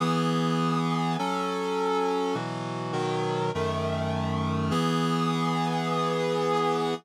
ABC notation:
X:1
M:4/4
L:1/8
Q:1/4=102
K:E
V:1 name="Clarinet"
[E,B,G]4 [F,CA]4 | [B,,E,F,]2 [B,,D,F,]2 [F,,D,A,]4 | [E,B,G]8 |]